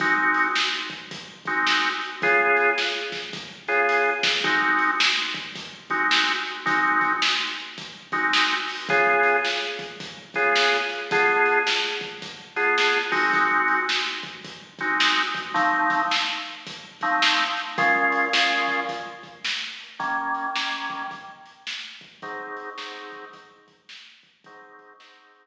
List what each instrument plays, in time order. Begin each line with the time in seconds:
0.00 drawbar organ G#3 C4 D#4 F#4, kick, closed hi-hat
0.34 closed hi-hat
0.55 snare
0.90 kick, closed hi-hat
1.11 kick, closed hi-hat
1.45 drawbar organ G#3 C4 D#4 F#4, kick, closed hi-hat
1.67 snare
2.01 closed hi-hat
2.22 drawbar organ C#3 B3 F4 G#4, kick, closed hi-hat
2.57 closed hi-hat
2.78 snare
3.12 kick, snare
3.33 kick, closed hi-hat
3.68 drawbar organ C#3 B3 F4 G#4, closed hi-hat
3.89 closed hi-hat
4.23 kick, snare
4.44 drawbar organ G#3 C4 D#4 F#4, kick, closed hi-hat
4.79 closed hi-hat
5.00 snare
5.34 kick, closed hi-hat
5.56 kick, closed hi-hat
5.90 drawbar organ G#3 C4 D#4 F#4, kick, closed hi-hat
6.11 snare
6.45 closed hi-hat
6.66 drawbar organ G#3 C4 D#4 F#4, kick, closed hi-hat
7.01 kick, closed hi-hat
7.22 snare
7.57 closed hi-hat
7.78 kick, closed hi-hat
8.12 drawbar organ G#3 C4 D#4 F#4, kick, closed hi-hat
8.33 snare
8.68 open hi-hat
8.89 drawbar organ C#3 B3 F4 G#4, kick, closed hi-hat
9.23 closed hi-hat
9.45 snare
9.79 kick, closed hi-hat
10.00 kick, closed hi-hat
10.34 drawbar organ C#3 B3 F4 G#4, kick, closed hi-hat
10.56 snare
10.90 closed hi-hat
11.11 drawbar organ D3 B3 F4 G#4, kick, closed hi-hat
11.45 closed hi-hat
11.67 snare
12.01 kick, closed hi-hat
12.22 kick, closed hi-hat
12.56 drawbar organ D3 B3 F4 G#4, closed hi-hat
12.78 snare
13.12 drawbar organ G#3 C4 D#4 F#4, kick, open hi-hat
13.33 kick, closed hi-hat
13.68 closed hi-hat
13.89 snare
14.23 kick, closed hi-hat
14.45 kick, closed hi-hat
14.79 drawbar organ G#3 C4 D#4 F#4, kick, closed hi-hat
15.00 snare
15.34 kick, closed hi-hat
15.54 drawbar organ F3 A3 C4 D#4, kick, closed hi-hat
15.90 kick, closed hi-hat
16.11 snare
16.45 closed hi-hat
16.67 kick, closed hi-hat
17.01 drawbar organ F3 A3 C4 D#4, kick, closed hi-hat
17.22 snare
17.57 closed hi-hat
17.78 drawbar organ A#2 G#3 C#4 F4, kick, closed hi-hat
18.12 closed hi-hat
18.33 drawbar organ A#2 G#3 C#4 F4, snare
18.68 kick, closed hi-hat
18.89 kick, closed hi-hat
19.23 kick, closed hi-hat
19.45 snare
19.79 closed hi-hat
19.99 drawbar organ D#3 G3 A#3 C#4, kick, closed hi-hat
20.34 closed hi-hat
20.56 drawbar organ D#3 G3 A#3 C#4, snare
20.90 kick, closed hi-hat
21.11 kick, closed hi-hat
21.46 closed hi-hat
21.67 snare
22.01 kick, closed hi-hat
22.22 drawbar organ G#2 F#3 C4 D#4, kick, closed hi-hat
22.57 closed hi-hat
22.78 drawbar organ G#2 F#3 C4 D#4, snare
23.12 kick, closed hi-hat
23.33 kick, closed hi-hat
23.68 kick, closed hi-hat
23.89 snare
24.23 kick, closed hi-hat
24.44 drawbar organ G#2 F#3 C4 D#4, kick, closed hi-hat
24.79 kick, closed hi-hat
25.00 drawbar organ G#2 F#3 C4 D#4, snare
25.34 closed hi-hat